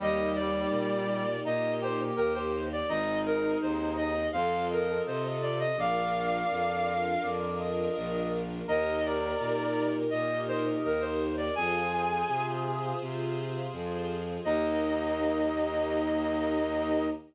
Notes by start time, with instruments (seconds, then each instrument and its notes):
0.00 violin D#2, brass section G3, string ensemble 1 A#3 D#4 G4, flute D#5
0.35 flute D5
0.70 violin A#2
1.45 violin A#2, brass section D#4, flute D#5
1.81 brass section G4, flute C5
2.16 violin D#2, brass section G4, flute A#4
2.34 brass section G4, flute C5
2.72 flute D5
2.88 violin G#1, string ensemble 1 C4 D#4 G#4, brass section D#4, flute D#5
3.26 flute A#4
3.62 violin D#2, flute C5
3.97 flute D#5
4.33 violin F2, string ensemble 1 C4 F4 A4, brass section C5, flute F5
4.70 flute A#4, brass section D#5
5.06 violin C3, flute C5, brass section D#5
5.24 brass section D#5
5.42 flute D5
5.59 flute D#5
5.77 violin A#1, string ensemble 1 D4 F4 A#4, brass section D5, flute F5
6.51 violin F2
7.23 violin F2, brass section D5
7.59 brass section D#5
7.95 violin A#1, brass section D#5
8.13 brass section D#5
8.67 violin D#2, string ensemble 1 D#4 G4 A#4, brass section A#4, flute D#5
9.05 flute D5
9.40 violin A#2
10.10 violin A#2, flute D#5, brass section D#5
10.48 flute C5, brass section D#5
10.84 violin D#2, flute A#4, brass section D#5
11.00 flute C5, brass section D#5
11.37 flute D5
11.55 violin F2, string ensemble 1 F4 G#4 C5, brass section G#4, flute G#5
12.28 violin C3
13.02 violin C3
13.73 violin F2
14.45 violin D#2, string ensemble 1 A#3 D#4 G4, brass section D#4, flute D#5